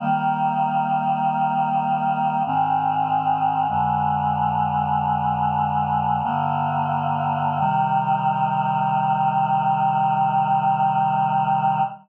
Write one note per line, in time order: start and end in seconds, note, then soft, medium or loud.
0.00 2.43 D#3 loud
0.00 2.43 G3 medium
0.00 2.43 A#3 loud
2.46 3.67 G#2 loud
2.46 3.67 D#3 loud
2.46 3.67 C4 loud
3.69 6.22 F2 medium
3.69 6.22 D3 loud
3.69 6.22 G#3 loud
6.23 7.59 G2 medium
6.23 7.59 D3 loud
6.23 7.59 A#3 loud
7.59 11.82 C3 loud
7.59 11.82 D#3 loud
7.59 11.82 G3 loud